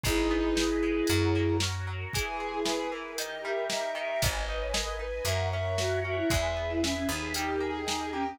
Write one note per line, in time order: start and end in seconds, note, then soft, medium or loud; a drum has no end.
0.03 1.01 G#1 medium
0.03 0.82 G#3 medium
0.03 0.53 D#4 loud
0.03 1.57 E4 medium
0.03 1.08 G#4 medium
0.03 1.57 G#4 medium
0.03 1.08 B4 medium
0.03 1.08 D#5 medium
0.03 kick loud
0.03 closed hi-hat medium
0.31 1.05 B3 medium
0.55 1.05 D#4 medium
0.55 snare loud
0.82 1.07 G#3 medium
1.07 2.05 F#2 medium
1.07 1.87 F#3 medium
1.07 2.12 F#4 medium
1.07 2.12 A#4 medium
1.07 2.12 C#5 medium
1.07 closed hi-hat medium
1.35 2.09 A#3 medium
1.60 2.12 C#4 medium
1.60 snare loud
1.87 2.12 F#3 medium
2.13 2.91 E3 medium
2.13 3.17 E4 medium
2.13 3.17 G#4 medium
2.13 2.59 G#4 loud
2.13 3.17 B4 medium
2.13 kick loud
2.13 closed hi-hat loud
2.40 3.14 G#3 medium
2.54 2.66 G#4 medium
2.65 3.14 B3 medium
2.65 2.90 G#4 medium
2.65 2.77 B4 medium
2.65 snare loud
2.78 2.90 B4 medium
2.90 3.16 E3 medium
2.90 3.14 A#4 medium
3.17 3.94 D#3 medium
3.17 4.21 D#4 medium
3.17 4.21 G4 medium
3.17 3.65 A#4 medium
3.17 4.21 A#4 loud
3.17 3.41 D#5 loud
3.17 closed hi-hat loud
3.44 4.19 G3 medium
3.44 3.92 E5 loud
3.69 4.19 A#3 medium
3.69 3.93 D#5 medium
3.69 snare loud
3.94 4.20 D#3 medium
3.94 4.06 D#5 medium
3.94 4.21 E5 medium
4.09 4.22 E5 medium
4.22 5.19 G#1 medium
4.22 4.45 B3 medium
4.22 5.25 B4 medium
4.22 4.64 D#5 loud
4.22 5.25 D#5 medium
4.22 5.25 G#5 medium
4.22 kick loud
4.22 closed hi-hat loud
4.49 4.72 D#4 medium
4.60 4.73 C#5 medium
4.73 4.97 G#4 medium
4.73 4.86 A#4 medium
4.73 4.97 D#5 loud
4.73 snare loud
4.88 5.01 A#4 medium
4.99 5.22 D#4 medium
4.99 5.24 B4 medium
5.24 6.21 F#2 medium
5.24 5.50 A#3 medium
5.24 5.77 A#4 medium
5.24 6.30 A#4 medium
5.24 6.30 C#5 loud
5.24 5.46 E5 loud
5.24 6.30 F#5 medium
5.24 closed hi-hat medium
5.52 5.77 C#4 medium
5.52 5.98 E5 loud
5.77 6.01 F#4 medium
5.77 6.00 F#4 medium
5.77 snare loud
6.04 6.28 C#4 medium
6.04 6.16 F#4 medium
6.04 6.30 E5 medium
6.17 6.29 E4 medium
6.30 7.05 E2 medium
6.30 6.54 G#3 loud
6.30 7.34 G#4 medium
6.30 7.34 B4 medium
6.30 7.34 E5 medium
6.30 6.75 E5 loud
6.30 kick loud
6.30 closed hi-hat medium
6.56 6.80 B3 medium
6.70 6.82 E4 medium
6.81 6.94 C#4 medium
6.81 7.07 E4 medium
6.81 7.05 E5 loud
6.81 snare loud
6.96 7.08 C#4 medium
7.09 8.31 D#2 medium
7.09 7.32 B3 medium
7.09 7.33 D#4 medium
7.34 7.59 G3 medium
7.34 7.81 D#4 medium
7.34 8.38 G4 medium
7.34 7.59 G4 loud
7.34 8.38 A#4 medium
7.34 8.38 D#5 medium
7.34 closed hi-hat loud
7.60 7.84 A#3 medium
7.60 8.10 G#4 medium
7.87 8.10 D#4 medium
7.87 8.12 D#4 medium
7.87 snare loud
8.12 8.36 A#3 medium
8.12 8.25 C#4 medium
8.12 8.37 G4 medium
8.26 8.39 C#4 medium